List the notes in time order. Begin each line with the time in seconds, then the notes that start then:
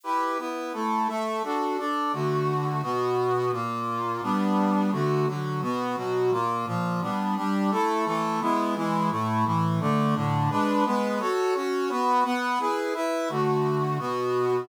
0.03 E4 G4 B4
0.38 B3 E4 B4
0.73 A3 E4 A4
1.08 A3 A4 E5
1.43 D4 F#4 A4
1.78 D4 A4 D5
2.13 D3 A3 F#4
2.83 B2 B3 F#4
3.52 A#2 A#3 F4
4.22 G3 B3 D4
4.92 D3 A3 F#4
5.27 D3 F#3 F#4
5.62 B2 B3 F#4
5.97 B2 F#3 F#4
6.31 A#2 A#3 F4
6.66 A#2 F3 F4
7.01 G3 B3 D4
7.36 G3 D4 G4
7.71 A3 E4 A4
8.06 E3 A3 A4
8.41 G#3 B3 E4
8.76 E3 G#3 E4
9.10 A2 A3 E4
9.45 A2 E3 E4
9.80 D3 A3 D4
10.15 A2 D3 D4
10.50 G#3 D4 B4
10.85 G#3 B3 B4
11.20 F#4 A4 C#5
11.55 C#4 F#4 C#5
11.90 B3 F#4 B4
12.24 B3 B4 F#5
12.59 E4 G#4 B4
12.94 E4 B4 E5
13.29 D3 A3 F#4
13.99 B2 B3 F#4